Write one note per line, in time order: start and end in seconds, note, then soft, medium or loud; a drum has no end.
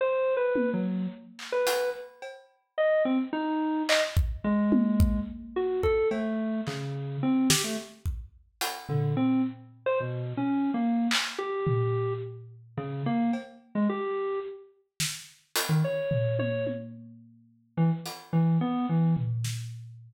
0.01 0.34 C5 medium
0.37 0.70 B4 medium
0.56 high tom medium
0.73 1.07 F#3 medium
1.39 clap medium
1.52 1.90 B4 medium
1.67 closed hi-hat medium
2.22 cowbell medium
2.78 3.03 D#5 medium
3.05 3.18 C4 loud
3.33 3.83 D#4 medium
3.89 4.02 D#5 loud
3.89 clap loud
4.17 kick medium
4.44 5.19 G#3 loud
4.72 high tom loud
5.00 kick loud
5.56 5.81 F#4 medium
5.83 6.08 A4 medium
5.83 kick medium
6.11 6.61 A3 medium
6.11 cowbell medium
6.67 7.17 C#3 medium
6.67 clap medium
7.23 7.48 C4 medium
7.50 7.63 G4 loud
7.50 snare loud
7.64 7.77 A3 medium
8.06 kick medium
8.61 closed hi-hat medium
8.89 9.14 D3 medium
8.89 floor tom medium
9.17 9.42 C4 medium
9.86 9.99 C5 loud
10.00 10.33 B2 medium
10.37 10.71 C#4 medium
10.74 11.07 A#3 medium
11.11 clap loud
11.38 12.13 G4 medium
11.67 floor tom medium
12.77 13.02 C#3 loud
13.06 13.31 A#3 loud
13.33 cowbell medium
13.75 13.88 G#3 medium
13.89 14.39 G4 medium
15.00 snare medium
15.56 closed hi-hat loud
15.69 15.81 D#3 medium
15.84 16.34 C#5 medium
16.11 floor tom medium
16.39 16.64 C#5 medium
16.39 high tom medium
16.67 high tom medium
17.77 17.90 E3 medium
18.06 closed hi-hat medium
18.33 18.58 E3 medium
18.61 18.86 B3 loud
18.89 19.14 E3 medium
19.17 floor tom medium
19.44 snare medium